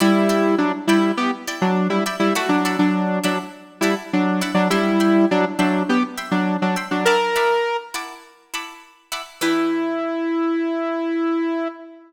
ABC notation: X:1
M:4/4
L:1/16
Q:1/4=102
K:Em
V:1 name="Lead 2 (sawtooth)"
[G,E]4 [F,D] z [G,E]2 [B,G] z2 [F,D]2 [G,E] z [G,E] | [A,F] [F,D]2 [F,D]3 [F,D] z3 [G,E] z [F,D]2 z [F,D] | [G,E]4 [F,D] z [F,D]2 [B,G] z2 [F,D]2 [F,D] z [F,D] | ^A6 z10 |
E16 |]
V:2 name="Pizzicato Strings"
[Edgb]2 [Edgb]4 [Edgb]4 [Edgb]4 [Edgb]2 | [Edfab]2 [Edfab]4 [Edfab]4 [Edfab]4 [Edfab]2 | [egbc']2 [egbc']4 [egbc']4 [egbc']4 [egbc']2 | [Efabd']2 [Efabd']4 [Efabd']4 [Efabd']4 [Efabd']2 |
[E,DGB]16 |]